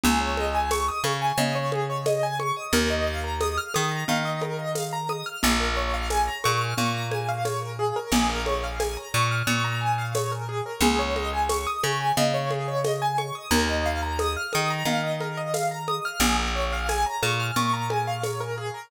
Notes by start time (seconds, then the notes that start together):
0.04 C#2 G#4, low conga
0.20 C#5
0.37 D#5, high conga
0.54 G#5
0.71 C#6, tambourine, high conga
0.88 D#6
1.04 C#3 C#6, high conga
1.21 G#5
1.38 C#3 D#5, low conga
1.55 C#5
1.72 G#4, high conga
1.89 C#5
2.06 D#5, tambourine, high conga
2.23 G#5
2.39 C#6, high conga
2.56 D#6
2.73 D#2 A#4, low conga
2.90 D#5
3.07 F5
3.24 A#5
3.41 D#6, tambourine, high conga
3.57 F6
3.74 D#3 D#6, high conga
3.91 A#5
4.08 D#3 F5, low conga
4.25 D#5
4.41 A#4, high conga
4.59 D#5
4.75 F5, tambourine, high conga
4.93 A#5
5.09 D#6, high conga
5.26 F6
5.42 A#1 G#4, low conga
5.60 A#4
5.76 C#5
5.93 F5
6.10 G#5, tambourine, high conga
6.27 A#5
6.44 A#2 C#6, high conga
6.61 F6
6.78 A#2 C#6, low conga
6.94 A#5
7.11 G#5, high conga
7.28 F5
7.45 C#5, tambourine, high conga
7.62 A#4
7.79 G#4
7.96 A#4
8.12 A#1 G#4, crash, low conga
8.29 A#4
8.46 C#5, high conga
8.63 F5
8.80 G#5, tambourine, high conga
8.97 A#5
9.14 A#2 C#6
9.31 F6
9.47 A#2 C#6, low conga
9.64 A#5
9.81 G#5
9.98 F5
10.15 C#5, tambourine, high conga
10.31 A#4
10.48 G#4
10.66 A#4
10.80 C#2 G#4, low conga
10.99 C#5
11.16 D#5, high conga
11.33 G#5
11.49 C#6, tambourine, high conga
11.67 D#6
11.83 C#3 C#6, high conga
12.00 G#5
12.17 C#3 D#5, low conga
12.34 C#5
12.51 G#4, high conga
12.68 C#5
12.84 D#5, tambourine, high conga
13.01 G#5
13.18 C#6, high conga
13.35 D#6
13.51 D#2 A#4, low conga
13.69 D#5
13.85 F5
14.02 A#5
14.19 D#6, tambourine, high conga
14.36 F6
14.53 D#3 D#6, high conga
14.70 A#5
14.85 D#3 F5, low conga
15.03 D#5
15.21 A#4, high conga
15.37 D#5
15.54 F5, tambourine, high conga
15.71 A#5
15.88 D#6, high conga
16.05 F6
16.20 A#1 G#4, low conga
16.38 A#4
16.55 C#5
16.72 F5
16.89 G#5, tambourine, high conga
17.06 A#5
17.22 A#2 C#6, high conga
17.39 F6
17.56 A#2 C#6, low conga
17.73 A#5
17.90 G#5, high conga
18.07 F5
18.23 C#5, tambourine, high conga
18.40 A#4
18.57 G#4
18.74 A#4